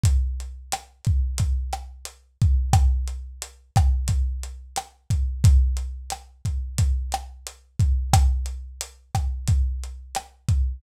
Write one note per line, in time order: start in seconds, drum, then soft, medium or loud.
0.04 kick loud
0.04 closed hi-hat loud
0.40 closed hi-hat medium
0.72 cross-stick loud
0.72 closed hi-hat loud
1.05 kick medium
1.05 closed hi-hat medium
1.38 kick medium
1.38 closed hi-hat loud
1.73 cross-stick medium
1.73 closed hi-hat medium
2.05 closed hi-hat loud
2.42 kick loud
2.42 closed hi-hat medium
2.73 kick loud
2.73 cross-stick loud
2.73 closed hi-hat loud
3.08 closed hi-hat medium
3.42 closed hi-hat loud
3.76 kick loud
3.76 cross-stick loud
3.76 closed hi-hat medium
4.08 kick medium
4.08 closed hi-hat loud
4.43 closed hi-hat medium
4.76 cross-stick loud
4.76 closed hi-hat loud
5.10 kick medium
5.10 closed hi-hat medium
5.44 kick loud
5.44 closed hi-hat loud
5.77 closed hi-hat medium
6.10 cross-stick medium
6.10 closed hi-hat loud
6.45 kick medium
6.45 closed hi-hat medium
6.78 kick medium
6.78 closed hi-hat loud
7.12 cross-stick loud
7.12 closed hi-hat medium
7.47 closed hi-hat loud
7.79 kick loud
7.79 closed hi-hat medium
8.13 kick loud
8.13 cross-stick loud
8.13 closed hi-hat loud
8.46 closed hi-hat medium
8.81 closed hi-hat loud
9.15 kick medium
9.15 cross-stick medium
9.15 closed hi-hat medium
9.47 kick loud
9.47 closed hi-hat loud
9.84 closed hi-hat medium
10.15 cross-stick loud
10.15 closed hi-hat loud
10.48 kick medium
10.48 closed hi-hat medium